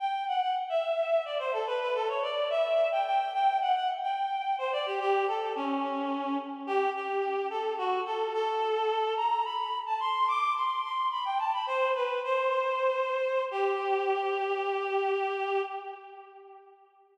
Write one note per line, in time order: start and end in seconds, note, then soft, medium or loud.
0.00 0.24 G5 loud
0.28 0.41 F#5 medium
0.42 0.55 F#5 medium
0.69 1.23 E5 medium
1.25 1.38 D5 medium
1.39 1.52 C5 medium
1.53 1.66 A4 medium
1.67 1.80 B4 medium
1.81 1.94 B4 medium
1.94 2.08 A4 medium
2.08 2.22 C#5 medium
2.22 2.49 D5 medium
2.50 2.88 E5 loud
2.92 3.05 G5 medium
3.06 3.32 G5 loud
3.33 3.58 G5 loud
3.61 3.74 F#5 medium
3.75 3.88 F#5 medium
4.03 4.55 G5 medium
4.58 4.72 C5 medium
4.72 4.85 D5 medium
4.86 4.99 G4 medium
5.00 5.25 G4 loud
5.28 5.53 A4 medium
5.56 6.37 C#4 medium
6.67 6.90 G4 loud
6.94 7.47 G4 medium
7.50 7.74 A4 medium
7.78 8.00 F#4 medium
8.06 8.33 A4 medium
8.33 9.14 A4 loud
9.17 9.44 A#5 loud
9.44 9.78 B5 medium
9.86 9.99 A5 medium
10.00 10.27 C6 loud
10.28 10.53 D6 loud
10.56 10.81 C6 medium
10.83 11.07 C6 medium
11.11 11.24 B5 medium
11.25 11.38 G5 medium
11.39 11.52 A5 medium
11.53 11.66 B5 medium
11.67 11.92 C5 loud
11.95 12.19 B4 medium
12.24 13.43 C5 medium
13.51 15.62 G4 loud